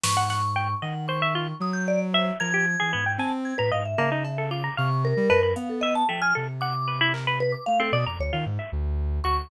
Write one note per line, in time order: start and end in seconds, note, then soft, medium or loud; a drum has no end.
0.04 0.75 G#2 medium
0.04 0.15 B4 medium
0.04 0.75 C#6 loud
0.04 snare loud
0.17 0.29 F#5 loud
0.30 0.42 F#5 medium
0.30 snare medium
0.56 0.68 G5 loud
0.82 1.53 D#3 medium
0.82 0.94 D#5 medium
0.82 1.06 F#5 medium
1.08 1.21 C5 loud
1.08 1.55 C#6 medium
1.22 1.34 E5 loud
1.35 1.47 F4 medium
1.60 2.31 F#3 loud
1.60 1.73 D#6 medium
1.73 1.85 G6 medium
1.88 2.00 D5 loud
2.14 2.25 C5 soft
2.14 2.38 E5 loud
2.40 2.76 F3 medium
2.40 2.52 A#4 medium
2.40 3.11 G#6 loud
2.54 2.66 G4 medium
2.80 2.93 E3 medium
2.80 2.92 G#4 medium
2.93 3.17 G#2 medium
2.93 3.05 B3 medium
3.06 3.18 G5 medium
3.18 3.54 C4 loud
3.18 3.31 G#5 medium
3.18 3.31 A5 medium
3.45 3.57 G#6 soft
3.58 3.71 A2 medium
3.58 3.70 B4 loud
3.58 3.71 A#5 medium
3.71 3.95 G#2 medium
3.71 3.83 D#5 medium
3.71 3.84 F5 medium
3.85 4.45 E5 medium
3.98 4.69 C#3 medium
3.98 4.10 A#3 medium
3.98 cowbell medium
4.12 4.23 D#4 medium
4.25 cowbell medium
4.38 4.50 A4 medium
4.51 4.63 F4 medium
4.51 4.75 D6 medium
4.64 4.76 A#5 medium
4.77 5.13 C3 loud
4.77 4.89 F5 medium
4.77 5.02 C#6 medium
5.05 5.52 A#4 loud
5.17 5.29 G3 loud
5.30 5.54 F#2 medium
5.30 5.42 B4 loud
5.30 cowbell loud
5.43 5.55 B4 medium
5.56 6.03 B3 medium
5.56 5.68 F5 medium
5.56 closed hi-hat medium
5.70 5.81 A4 medium
5.81 5.93 D#5 loud
5.81 5.95 E5 loud
5.95 6.07 A5 loud
6.09 6.33 F3 soft
6.09 6.21 A3 medium
6.09 6.21 G5 medium
6.22 6.34 G#5 medium
6.22 6.33 F6 loud
6.35 7.55 C3 medium
6.35 6.47 A4 medium
6.61 6.73 F#5 medium
6.61 7.08 D6 medium
6.88 6.99 B4 medium
7.01 7.13 E4 loud
7.14 7.26 A#4 medium
7.14 clap medium
7.27 7.39 B4 loud
7.40 7.52 B4 loud
7.52 7.64 D6 medium
7.66 7.91 A3 medium
7.66 7.78 F5 loud
7.80 7.91 C4 medium
7.80 7.92 A4 medium
7.92 8.04 B2 loud
7.92 8.05 D5 loud
7.92 8.05 D#6 medium
8.06 8.18 F2 medium
8.06 8.18 A#5 loud
8.06 8.19 D6 medium
8.19 8.31 D2 medium
8.19 8.32 C#5 loud
8.33 8.45 D#3 medium
8.33 8.45 F4 medium
8.46 8.58 G#2 loud
8.59 8.71 E5 medium
8.72 9.20 D2 loud
9.24 9.48 D2 medium
9.24 9.48 F#4 medium
9.24 9.48 C#6 loud